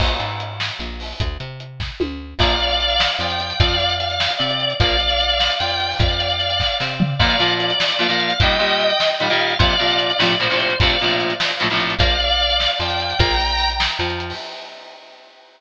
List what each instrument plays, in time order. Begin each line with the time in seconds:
0.00 electric bass (finger) A#1, kick, crash
0.20 electric bass (finger) G#2, closed hi-hat
0.40 closed hi-hat
0.60 snare
0.79 electric bass (finger) A#1, closed hi-hat
1.00 open hi-hat
1.20 electric bass (finger) D2, kick, closed hi-hat
1.40 electric bass (finger) C3, closed hi-hat
1.60 closed hi-hat
1.80 kick, snare
2.00 electric bass (finger) D2, high tom
2.39 electric bass (finger) A#1, overdriven guitar F3 A#3, drawbar organ D5 F5, kick, crash
2.50 closed hi-hat
2.60 closed hi-hat
2.70 closed hi-hat
2.80 closed hi-hat
2.90 closed hi-hat
3.00 snare
3.10 closed hi-hat
3.19 electric bass (finger) F2, overdriven guitar F3, drawbar organ G5, closed hi-hat
3.30 closed hi-hat
3.40 closed hi-hat
3.50 closed hi-hat
3.60 electric bass (finger) F2, overdriven guitar F3 C4, drawbar organ D5 F5, kick, closed hi-hat
3.70 closed hi-hat
3.80 closed hi-hat
3.90 closed hi-hat
4.00 drawbar organ F5, closed hi-hat
4.10 closed hi-hat
4.20 snare
4.30 closed hi-hat
4.38 electric bass (finger) C3, overdriven guitar C4, drawbar organ D5, closed hi-hat
4.50 closed hi-hat
4.60 closed hi-hat
4.70 closed hi-hat
4.80 electric bass (finger) A#1, overdriven guitar F3 A#3, drawbar organ D5 F5, kick, closed hi-hat
4.90 closed hi-hat
5.00 closed hi-hat
5.10 closed hi-hat
5.20 closed hi-hat
5.30 closed hi-hat
5.40 snare
5.50 closed hi-hat
5.60 electric bass (finger) F2, overdriven guitar F3, drawbar organ G5, closed hi-hat
5.70 closed hi-hat
5.80 closed hi-hat
5.90 open hi-hat
5.99 electric bass (finger) F2, drawbar organ D5 F5, kick, closed hi-hat
6.10 closed hi-hat
6.20 closed hi-hat
6.30 closed hi-hat
6.40 closed hi-hat
6.50 closed hi-hat
6.60 kick, snare
6.80 electric bass (finger) C3, overdriven guitar C4, snare
7.00 floor tom
7.19 overdriven guitar A#2 F3 A#3, drawbar organ D5 F5, kick, crash
7.30 closed hi-hat
7.39 overdriven guitar A#2 F3 A#3, closed hi-hat
7.50 closed hi-hat
7.60 drawbar organ D5, closed hi-hat
7.70 closed hi-hat
7.80 snare
7.90 closed hi-hat
7.99 overdriven guitar A#2 F3 A#3, drawbar organ F5, closed hi-hat
8.09 overdriven guitar A#2 F3 A#3, closed hi-hat
8.20 closed hi-hat
8.30 closed hi-hat
8.40 overdriven guitar A#2 D#3 G3, drawbar organ D#5 G5, kick, closed hi-hat
8.50 closed hi-hat
8.59 overdriven guitar A#2 D#3 G3, closed hi-hat
8.70 closed hi-hat
8.80 closed hi-hat
8.90 closed hi-hat
9.00 snare
9.10 closed hi-hat
9.20 overdriven guitar A#2 D#3 G3, drawbar organ F5, closed hi-hat
9.30 overdriven guitar A#2 D#3 G3, closed hi-hat
9.40 closed hi-hat
9.50 closed hi-hat
9.59 overdriven guitar A#2 C3 F3, drawbar organ D5 F5, kick, closed hi-hat
9.70 closed hi-hat
9.79 overdriven guitar A#2 C3 F3, closed hi-hat
9.90 closed hi-hat
10.00 drawbar organ D5, closed hi-hat
10.10 closed hi-hat
10.19 overdriven guitar A#1 A2 C3 F3, snare
10.30 closed hi-hat
10.39 overdriven guitar A#1 A2 C3 F3, drawbar organ C5, closed hi-hat
10.50 overdriven guitar A#1 A2 C3 F3, closed hi-hat
10.60 closed hi-hat
10.70 closed hi-hat
10.80 overdriven guitar A#1 A2 C3 F3, drawbar organ D5 F5, kick, closed hi-hat
10.90 closed hi-hat
11.00 overdriven guitar A#1 A2 C3 F3, closed hi-hat
11.10 closed hi-hat
11.20 closed hi-hat
11.30 closed hi-hat
11.40 snare
11.50 closed hi-hat
11.60 overdriven guitar A#1 A2 C3 F3, closed hi-hat
11.70 overdriven guitar A#1 A2 C3 F3, closed hi-hat
11.80 closed hi-hat
11.90 closed hi-hat
11.99 electric bass (finger) A#1, overdriven guitar F3 A#3, drawbar organ D5 F5, kick, closed hi-hat
12.10 closed hi-hat
12.20 closed hi-hat
12.30 closed hi-hat
12.40 closed hi-hat
12.50 closed hi-hat
12.60 snare
12.70 closed hi-hat
12.80 electric bass (finger) F2, overdriven guitar F3, drawbar organ G5, closed hi-hat
12.90 closed hi-hat
13.00 closed hi-hat
13.10 closed hi-hat
13.19 electric bass (finger) A#1, overdriven guitar F3 A#3, drawbar organ G5 A#5, kick, closed hi-hat
13.30 closed hi-hat
13.40 closed hi-hat
13.50 closed hi-hat
13.60 closed hi-hat
13.70 closed hi-hat
13.80 snare
13.90 closed hi-hat
13.99 electric bass (finger) F2, overdriven guitar F3, closed hi-hat
14.10 closed hi-hat
14.20 closed hi-hat
14.30 open hi-hat